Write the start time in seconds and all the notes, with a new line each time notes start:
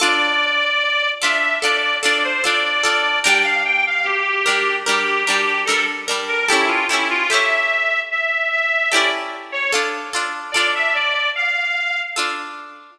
0.00 D4 F4 A4 D5
1.22 D4 F4 A4 E5
1.62 D4 F4 A4 D5
2.03 D4 F4 A4 D5
2.24 C5
2.44 D4 F4 A4 D5
2.83 D4 F4 A4
3.23 G3 D4 A#4 G5
3.44 F5
3.65 G5
3.87 F5
4.04 G4
4.46 G3 D4 A#4
4.86 G3 D4 G4 A#4
5.26 D4 G4 A#4
5.30 G3
5.65 D4 A4 A#4
5.70 G3
6.08 G3 D4 A#4
6.28 A#4
6.48 C#4 E4 G4 A4
6.68 F4
6.89 E4 G4 A4
6.93 C#4
7.10 F4
7.30 E4 G4 A4 E5
7.34 C#4
8.11 E5
8.51 E5
8.91 E4 G4 A4 D5
8.96 C#4
9.52 C#5
9.72 D4 F4 A4
10.13 D4 F4 A4
10.52 F4 A4 D5
10.57 D4
10.75 E5
10.94 D5
11.35 F5
12.16 D4 F4 A4